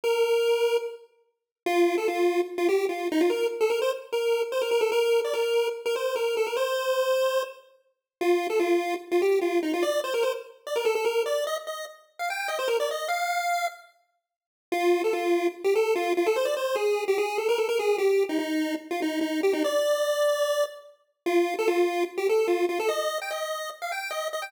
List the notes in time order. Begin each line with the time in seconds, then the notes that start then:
0.04 A#4
1.66 F4
1.98 A4
2.08 F4
2.58 F4
2.69 G4
2.89 F4
3.12 D#4
3.21 F4
3.30 A#4
3.61 A4
3.70 A#4
3.82 C5
4.12 A#4
4.52 C5
4.62 A#4
4.71 A#4
4.81 A4
4.92 A#4
5.24 D5
5.34 A#4
5.86 A#4
5.96 C5
6.16 A#4
6.37 A4
6.47 A#4
6.56 C5
8.21 F4
8.50 A4
8.60 F4
9.11 F4
9.22 G4
9.41 F4
9.63 D#4
9.74 F4
9.83 D5
10.04 C5
10.14 A#4
10.23 C5
10.67 D5
10.76 A#4
10.85 A4
10.95 A4
11.05 A#4
11.26 D5
11.47 D#5
11.67 D#5
12.19 F5
12.30 G5
12.48 D#5
12.59 C5
12.68 A#4
12.80 D5
12.91 D#5
13.08 F5
14.72 F4
15.04 A4
15.13 F4
15.64 G4
15.75 A4
15.95 F4
16.17 F4
16.26 A4
16.36 C5
16.45 D5
16.57 C5
16.75 G#4
17.08 G4
17.18 G#4
17.38 A4
17.49 A#4
17.58 A4
17.69 A#4
17.79 G#4
17.98 G4
18.29 D#4
18.39 D#4
18.91 F4
19.02 D#4
19.21 D#4
19.43 G4
19.53 D#4
19.64 D5
21.26 F4
21.59 A4
21.68 F4
22.18 G4
22.29 A4
22.48 F4
22.69 F4
22.80 A4
22.89 D#5
23.22 G5
23.31 D#5
23.82 F5
23.92 G5
24.11 D#5
24.33 D#5
24.42 G5